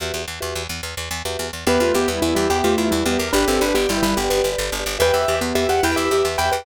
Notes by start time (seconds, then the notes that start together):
0.00 E2 F#4 G4 B4 E5
0.14 E2
0.28 E2
0.40 E2 F#4 G4 B4 E5
0.55 E2
0.69 E2
0.83 E2
0.97 E2
1.11 E2
1.25 E2 F#4 G4 B4 E5
1.39 E2
1.53 E2
1.67 E2 B3 G4 B4 E5
1.74 G4 B4 E5
1.80 E2 A3 F4 G4 B4 E5
1.87 G4 B4 E5
1.94 E2 B3 G4 B4 E5
2.01 G4 B4 E5
2.07 E2 G3 B3 E4
2.22 E2 G3 E4
2.28 G4 B4 E5
2.35 E2 G3 E4 G4
2.50 E2 B3 G4
2.59 G4 B4 E5
2.64 E2 A3 F4 G4 B4 E5
2.71 G4 B4 E5
2.77 E2 E4 G4 B4 E5
2.85 G4 B4 E5
2.91 E2 G3 E4
3.06 E2 B3 G4
3.12 G4 B4 E5
3.18 E2 G4 A#4
3.33 G1 D4 G4 B4 D5
3.40 G4 B4 D5
3.46 G1 C4 G4 A4 B4 D5
3.53 G4 B4 D5
3.60 G1 D4 G4 B4 D5
3.68 G4 B4 D5
3.74 G1 B3 G4 G5
3.89 G1 G3 E4
3.97 G4 B4 D5
4.03 G1 G3 E4 B4
4.17 G1 B3 G4
4.24 G4 B4 D5
4.30 G1 G4 B4 D5
4.38 G4 B4 D5
4.44 G1 G4 B4 D5
4.52 G4 B4 D5
4.58 G1
4.72 G1
4.80 G4 B4 D5
4.86 G1
4.99 E2 G4 B4 E5 G5
5.08 G4 B4 E5
5.13 E2 G4 B4 E5
5.22 G4 B4 E5
5.28 E2 G4 B4 E5
5.36 G4 B4 E5
5.41 E2 B3
5.55 E2 G4 E5
5.63 G4 B4 E5
5.69 E2 G4 F#5
5.83 E2 E4 B4 G5
5.91 G4 B4 E5
5.96 E2 G4 B4 E5
6.05 G4 B4 E5
6.11 E2 G4 B4 E5
6.18 G4 B4 E5
6.24 E2 E5
6.38 E2 B4 G5
6.45 G4 B4 E5
6.52 E2 G4 B4 G5